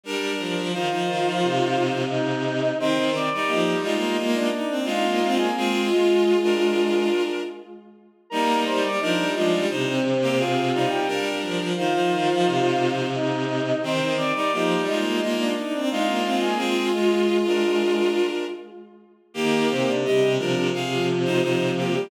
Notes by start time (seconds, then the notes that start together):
0.04 G3 D4 A#4
0.38 F3
0.56 F3
0.73 D#3 D#4 F4 C5 F5
0.90 F3 D#4 C5
1.07 D#3
1.25 F3
1.42 C3
2.10 D#4 D#5
2.80 D#3 C4 C5 C6
2.97 D#3
3.12 D#3 C4 D5 D6
3.30 G3 D#4 D5 D6
3.47 F3 A#3 D#4 G4 D#5
3.72 G3
3.83 G#3 D#4 F4 D#5
3.95 A#3
4.17 G#3 A#3 F4
4.34 D4 D5
4.53 D#4
4.69 C4
4.85 G#3 D#4 F4 F5
5.04 A#3
5.22 C4
5.38 A#3 G#4 G#5
5.56 G#3 C4 F4 G#4
5.91 G#3 F4 G#4
6.43 D4 A#4
8.30 G3 A#3 D#4 A#4 A#5
8.66 G3 C5 C6
8.83 G3 D5 D6
8.99 F3 D4 D#4 A#4 D#5
9.18 G3
9.35 F3 G#3 D4 F4 D5
9.52 G3
9.69 C3 D#4 C5
9.87 C4 C5
10.22 A#3 G4
10.36 C4 F4 G#4 F5
10.74 G3 D#4
10.88 G4 G5
11.07 G3 D4 A#4
11.42 F3
11.59 F3
11.76 D#3 D#4 F4 C5 F5
11.93 F3 D#4 C5
12.11 D#3
12.28 F3
12.45 C3
13.14 D#4 D#5
13.83 D#3 C4 C5 C6
14.00 D#3
14.16 D#3 C4 D5 D6
14.35 G3 D#4 D5 D6
14.52 F3 A#3 D#4 G4 D#5
14.75 G3
14.86 G#3 D#4 F4 D#5
14.98 A#3
15.21 G#3 A#3 F4
15.39 D4 D5
15.56 D#4
15.73 C4
15.91 G#3 D#4 F4 F5
16.08 A#3
16.25 C4
16.41 A#3 G#4 G#5
16.57 G#3 C4 F4 G#4
16.94 G#3 F4 G#4
17.46 D4 A#4
19.34 D#3 A#3 G4 A#4
19.69 C3 C4 C5
19.87 C3 D4 D5
20.04 C3 G3 G4 D#5
20.21 C3
20.37 C3 F3 D4 F4 A#4
20.56 C3
20.73 C3 G#4 F5
20.91 F3 F4
21.25 D#4 C5
21.42 F3 D#4 F4 C5
21.77 A#3 G4
21.93 G3 G4